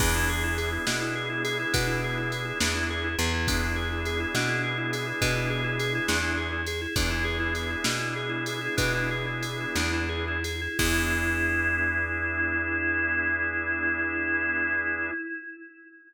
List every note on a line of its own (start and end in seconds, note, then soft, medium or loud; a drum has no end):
0.00 0.78 E2 loud
0.00 3.13 B3 loud
0.00 0.13 D4 medium
0.00 3.13 D4 loud
0.00 3.13 E4 loud
0.00 3.13 G#4 medium
0.00 kick loud
0.00 crash loud
0.16 0.29 E4 medium
0.29 0.43 G#4 medium
0.44 0.57 E4 medium
0.58 0.71 G#4 medium
0.58 ride medium
0.72 0.86 E4 medium
0.87 1.65 B2 medium
0.87 1.00 D4 medium
0.87 snare loud
1.01 1.15 E4 medium
1.15 1.29 G#4 medium
1.30 1.43 E4 medium
1.44 1.58 G#4 medium
1.44 ride medium
1.59 1.73 E4 medium
1.73 2.52 B2 medium
1.73 1.87 D4 medium
1.73 kick loud
1.73 ride loud
1.88 2.01 E4 medium
2.04 2.17 G#4 medium
2.18 2.31 E4 medium
2.32 2.45 G#4 medium
2.32 ride medium
2.45 2.58 E4 medium
2.60 3.16 E2 medium
2.60 2.74 D4 medium
2.60 snare loud
2.75 2.88 E4 medium
2.90 3.04 G#4 medium
3.04 3.18 E4 medium
3.19 4.26 E2 loud
3.19 3.32 G#4 medium
3.19 ride medium
3.34 3.47 E4 medium
3.48 6.61 B3 loud
3.48 3.61 D4 medium
3.48 6.61 D4 loud
3.48 6.61 E4 loud
3.48 6.61 G#4 loud
3.48 kick loud
3.48 ride loud
3.63 3.76 E4 medium
3.76 3.89 G#4 medium
3.92 4.05 E4 medium
4.05 4.20 G#4 medium
4.05 ride medium
4.20 4.33 E4 medium
4.35 5.13 B2 medium
4.35 4.49 D4 medium
4.35 snare loud
4.48 4.62 E4 medium
4.64 4.77 G#4 medium
4.78 4.91 E4 medium
4.93 5.07 G#4 medium
4.93 ride medium
5.07 5.20 E4 medium
5.21 6.00 B2 loud
5.21 5.35 D4 medium
5.21 kick medium
5.21 ride loud
5.37 5.50 E4 medium
5.50 5.63 G#4 medium
5.64 5.78 E4 medium
5.79 5.93 G#4 medium
5.79 ride medium
5.95 6.08 E4 medium
6.08 6.87 E2 medium
6.08 6.22 D4 medium
6.08 snare loud
6.22 6.35 E4 medium
6.37 6.51 G#4 medium
6.53 6.66 E4 medium
6.67 6.81 G#4 medium
6.67 ride medium
6.82 6.95 E4 medium
6.96 7.76 E2 loud
6.96 10.37 B3 loud
6.96 10.37 D4 loud
6.96 7.10 D4 medium
6.96 10.37 E4 medium
6.96 10.37 G#4 medium
6.96 kick loud
6.96 ride loud
7.10 7.24 E4 medium
7.24 7.38 G#4 medium
7.40 7.53 E4 medium
7.55 7.70 G#4 medium
7.55 ride medium
7.70 7.84 E4 medium
7.84 8.69 B2 medium
7.84 7.98 D4 medium
7.84 snare loud
8.00 8.14 E4 medium
8.16 8.30 G#4 medium
8.29 8.44 E4 medium
8.46 8.61 G#4 medium
8.46 ride medium
8.61 8.76 E4 medium
8.77 9.66 B2 loud
8.77 8.92 D4 medium
8.77 kick loud
8.77 ride loud
8.94 9.09 E4 medium
9.11 9.26 G#4 medium
9.27 9.42 E4 medium
9.42 9.58 G#4 medium
9.42 ride medium
9.60 9.76 E4 medium
9.75 10.68 E2 loud
9.75 9.91 D4 medium
9.75 snare loud
9.93 10.09 E4 medium
10.09 10.25 G#4 medium
10.28 10.44 E4 medium
10.44 10.60 G#4 medium
10.44 ride medium
10.61 10.78 E4 medium
10.79 15.11 E2 loud
10.79 15.11 B3 medium
10.79 15.11 D4 loud
10.79 15.11 E4 loud
10.79 15.11 G#4 medium
10.79 kick loud
10.79 crash loud